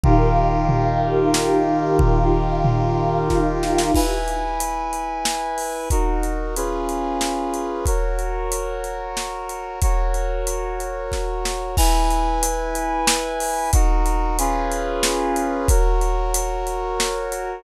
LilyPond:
<<
  \new Staff \with { instrumentName = "Brass Section" } { \time 3/4 \key des \lydian \tempo 4 = 92 <ees f' g' bes'>2.~ | <ees f' g' bes'>2. | \key e \lydian <e' b' gis''>2. | <dis' fis' ais'>4 <cis' eis' gis' b'>2 |
<fis' ais' cis''>2. | <fis' ais' cis''>2. | <e' b' gis''>2. | <dis' fis' ais'>4 <cis' eis' gis' b'>2 |
<fis' ais' cis''>2. | }
  \new Staff \with { instrumentName = "Pad 2 (warm)" } { \time 3/4 \key des \lydian <ees' g' bes' f''>2. | <ees' f' g' f''>2. | \key e \lydian r2. | r2. |
r2. | r2. | r2. | r2. |
r2. | }
  \new DrumStaff \with { instrumentName = "Drums" } \drummode { \time 3/4 <bd tomfh>4 tomfh4 sn4 | <bd tomfh>4 tomfh4 <bd sn>8 sn16 sn16 | <cymc bd>8 hh8 hh8 hh8 sn8 hho8 | <hh bd>8 hh8 hh8 hh8 sn8 hh8 |
<hh bd>8 hh8 hh8 hh8 sn8 hh8 | <hh bd>8 hh8 hh8 hh8 <bd sn>8 sn8 | <cymc bd>8 hh8 hh8 hh8 sn8 hho8 | <hh bd>8 hh8 hh8 hh8 sn8 hh8 |
<hh bd>8 hh8 hh8 hh8 sn8 hh8 | }
>>